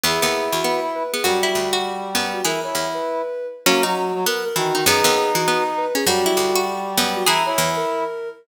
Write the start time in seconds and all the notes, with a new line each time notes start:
0.03 E2 B3 E4 G#4
0.22 D#2 B3
0.52 E2 F#4
0.64 B3
0.94 B4
1.13 B3 G#4
1.24 F#2 G3 F#4
1.43 E4
1.55 D2
1.73 F#4
2.15 F#2 B3
2.33 F#4
2.44 E3 E4 G#4 A#4
2.63 E4 C#5
2.75 E2
2.94 B4
3.66 F#3 A#3 C#4 F#4
3.83 F#3 D#4 F#4
4.14 F#3
4.26 B3 A#4
4.44 A#4
4.56 D#3 E3 F#4
4.74 D#3 D#4
4.86 F#2 B3 D#4 G#4
5.04 D#2 B3
5.35 E3 F#4
5.48 B3
5.77 B4
5.95 C#4 G#4
6.06 F#2 G3 F#4
6.26 E4
6.37 D2
6.55 F#4
6.97 F#2 B3
7.16 F#4
7.26 E3 E4 G#4 A#5
7.46 E4 C#5
7.58 E2
7.76 A#4